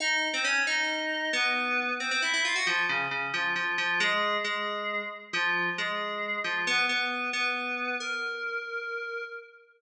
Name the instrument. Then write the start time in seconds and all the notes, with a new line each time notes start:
electric piano 2
0.00 D#4 D#5
0.33 C4 C5
0.44 C#4 C#5
0.67 D#4 D#5
1.33 B3 B4
2.00 C4 C5
2.11 C4 C5
2.22 E4 E5
2.33 E4 E5
2.45 F4 F5
2.55 F#4 F#5
2.67 F3 F4
2.89 C#3 C#4
3.11 C#3 C#4
3.34 F3 F4
3.56 F3 F4
3.78 F3 F4
4.00 G#3 G#4
4.44 G#3 G#4
5.33 F3 F4
5.78 G#3 G#4
6.44 F3 F4
6.67 B3 B4
6.89 B3 B4
7.33 B3 B4
8.00 A#4